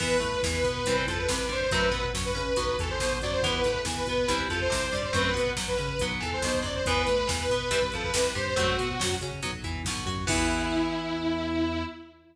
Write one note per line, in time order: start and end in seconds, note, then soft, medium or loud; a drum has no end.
0.00 0.19 E2 medium
0.00 0.16 E3 medium
0.00 0.16 B3 medium
0.00 0.41 B4 loud
0.00 kick medium
0.00 crash medium
0.10 kick medium
0.20 0.40 A2 medium
0.20 0.38 A3 medium
0.20 kick medium
0.20 closed hi-hat medium
0.32 kick medium
0.43 0.62 E2 medium
0.43 0.62 E3 medium
0.43 kick medium
0.43 snare medium
0.53 1.03 B4 medium
0.53 kick medium
0.64 0.83 B2 medium
0.64 0.83 B3 medium
0.64 kick medium
0.64 closed hi-hat medium
0.75 kick medium
0.85 1.05 C2 medium
0.85 1.06 E3 medium
0.85 1.06 G3 medium
0.85 1.06 C4 medium
0.85 kick medium
0.85 closed hi-hat medium
0.96 kick medium
1.07 1.26 F2 medium
1.07 1.26 F3 medium
1.07 1.17 A4 medium
1.07 kick medium
1.07 closed hi-hat medium
1.18 1.47 B4 medium
1.18 kick medium
1.28 1.46 C2 medium
1.28 1.47 C3 medium
1.28 kick medium
1.28 snare loud
1.38 kick medium
1.49 1.67 G2 medium
1.49 1.67 G3 medium
1.49 1.60 C5 loud
1.49 kick medium
1.49 closed hi-hat soft
1.61 1.71 C5 medium
1.61 kick medium
1.71 1.90 F#2 medium
1.71 1.89 F#3 medium
1.71 1.89 A3 medium
1.71 1.89 C4 medium
1.71 2.08 B4 medium
1.71 kick loud
1.71 closed hi-hat medium
1.82 kick medium
1.91 2.10 B2 medium
1.91 2.10 B3 medium
1.91 kick medium
1.91 closed hi-hat medium
2.03 kick medium
2.14 2.32 F#2 medium
2.14 2.33 F#3 medium
2.14 kick medium
2.14 snare medium
2.25 2.76 B4 medium
2.25 kick medium
2.35 2.55 C#3 medium
2.35 2.53 C#4 medium
2.35 kick medium
2.35 closed hi-hat medium
2.46 kick medium
2.56 2.76 B1 medium
2.56 2.76 F#3 medium
2.56 2.76 B3 medium
2.56 kick medium
2.56 closed hi-hat medium
2.67 kick medium
2.78 2.97 E2 medium
2.78 2.98 E3 medium
2.78 2.89 A4 medium
2.78 kick medium
2.78 closed hi-hat medium
2.89 3.18 C5 medium
2.89 kick medium
3.00 3.19 B1 medium
3.00 3.19 B2 medium
3.00 kick medium
3.00 snare medium
3.11 kick medium
3.21 3.40 F#2 medium
3.21 3.42 F#3 medium
3.21 3.32 D5 medium
3.21 kick medium
3.21 closed hi-hat medium
3.32 3.42 C5 medium
3.32 kick medium
3.43 3.62 E2 medium
3.43 3.61 E3 medium
3.43 3.61 B3 medium
3.43 3.83 B4 loud
3.43 kick medium
3.43 closed hi-hat medium
3.53 kick medium
3.63 3.84 A2 medium
3.63 3.83 A3 medium
3.63 kick medium
3.63 closed hi-hat medium
3.74 kick medium
3.85 4.03 E2 medium
3.85 4.04 E3 medium
3.85 kick medium
3.85 snare medium
3.96 4.40 B4 medium
3.96 kick medium
4.06 4.25 B2 medium
4.06 4.27 B3 medium
4.06 kick medium
4.06 closed hi-hat medium
4.18 kick medium
4.28 4.48 C2 medium
4.28 4.48 E3 medium
4.28 4.48 G3 medium
4.28 4.48 C4 medium
4.28 kick medium
4.28 closed hi-hat loud
4.39 kick medium
4.49 4.67 F2 medium
4.49 4.68 F3 medium
4.49 4.60 A4 medium
4.49 kick medium
4.49 closed hi-hat medium
4.60 4.92 C5 loud
4.60 kick medium
4.70 4.90 C2 medium
4.70 4.88 C3 medium
4.70 kick medium
4.70 snare medium
4.82 kick medium
4.92 5.11 G2 medium
4.92 5.10 G3 medium
4.92 5.03 D5 medium
4.92 kick medium
4.92 closed hi-hat medium
5.03 5.14 C5 medium
5.03 kick medium
5.13 5.32 F#2 medium
5.13 5.30 F#3 medium
5.13 5.30 A3 medium
5.13 5.30 C4 medium
5.13 5.50 B4 loud
5.13 kick medium
5.13 closed hi-hat medium
5.25 kick medium
5.34 5.53 B2 medium
5.34 5.52 B3 medium
5.34 kick medium
5.34 closed hi-hat medium
5.47 kick medium
5.57 5.75 F#2 medium
5.57 5.75 F#3 medium
5.57 kick medium
5.57 snare medium
5.67 6.10 B4 medium
5.67 kick medium
5.77 5.97 C#3 medium
5.77 5.95 C#4 medium
5.77 kick medium
5.77 closed hi-hat medium
5.88 kick medium
5.99 6.19 B1 medium
5.99 6.21 F#3 medium
5.99 6.21 B3 medium
5.99 kick medium
5.99 closed hi-hat medium
6.12 kick medium
6.20 6.40 E2 medium
6.20 6.39 E3 medium
6.20 6.31 A4 medium
6.20 kick medium
6.20 closed hi-hat medium
6.33 6.60 C5 medium
6.33 kick medium
6.42 6.62 B1 medium
6.42 6.62 B2 medium
6.42 kick medium
6.42 snare medium
6.54 kick medium
6.62 6.82 F#2 medium
6.62 6.81 F#3 medium
6.62 6.74 D5 medium
6.62 kick medium
6.62 closed hi-hat medium
6.75 6.85 C5 medium
6.75 kick medium
6.85 7.04 E2 medium
6.85 7.06 E3 medium
6.85 7.06 B3 medium
6.85 7.27 B4 loud
6.85 kick medium
6.85 closed hi-hat medium
6.97 kick medium
7.07 7.26 A2 medium
7.07 7.25 A3 medium
7.07 kick medium
7.07 closed hi-hat medium
7.18 kick medium
7.27 7.47 E2 medium
7.27 7.45 E3 medium
7.27 kick medium
7.27 snare loud
7.39 7.91 B4 loud
7.39 kick medium
7.50 7.69 B2 medium
7.50 7.69 B3 medium
7.50 kick medium
7.50 closed hi-hat medium
7.60 kick medium
7.71 7.89 C2 medium
7.71 7.79 E3 medium
7.71 7.79 G3 medium
7.71 7.79 C4 medium
7.71 kick medium
7.71 closed hi-hat loud
7.82 kick medium
7.92 8.11 F2 medium
7.92 8.12 F3 medium
7.92 8.03 A4 medium
7.92 kick medium
7.92 closed hi-hat medium
8.03 8.30 B4 loud
8.03 kick medium
8.14 8.32 C2 medium
8.14 8.33 C3 medium
8.14 kick medium
8.14 snare loud
8.24 kick medium
8.35 8.54 G2 medium
8.35 8.53 G3 medium
8.35 8.46 C5 medium
8.35 kick medium
8.35 closed hi-hat medium
8.46 8.57 C5 loud
8.46 kick medium
8.56 8.76 F#2 medium
8.56 8.76 F#3 medium
8.56 8.76 A3 medium
8.56 8.76 C4 medium
8.56 9.14 F#4 loud
8.56 kick medium
8.56 closed hi-hat medium
8.68 kick medium
8.78 8.97 B2 medium
8.78 8.97 B3 medium
8.78 kick medium
8.78 closed hi-hat medium
8.89 kick medium
8.99 9.18 F#2 medium
8.99 9.18 F#3 medium
8.99 kick medium
8.99 snare loud
9.11 kick medium
9.21 9.39 C#3 medium
9.21 9.40 C#4 medium
9.21 kick medium
9.21 closed hi-hat medium
9.32 kick medium
9.42 9.62 B1 medium
9.42 9.51 F#3 medium
9.42 9.51 B3 medium
9.42 kick medium
9.42 closed hi-hat medium
9.53 kick medium
9.63 9.83 E2 medium
9.63 9.82 E3 medium
9.63 kick medium
9.63 closed hi-hat medium
9.76 kick medium
9.85 10.04 B1 medium
9.85 10.06 B2 medium
9.85 kick medium
9.85 snare medium
9.97 kick medium
10.06 10.24 F#2 medium
10.06 10.25 F#3 medium
10.06 kick medium
10.06 closed hi-hat medium
10.17 kick medium
10.27 11.84 E2 loud
10.27 11.82 E3 loud
10.27 11.82 B3 loud
10.27 11.83 E4 loud
10.27 kick loud
10.27 crash loud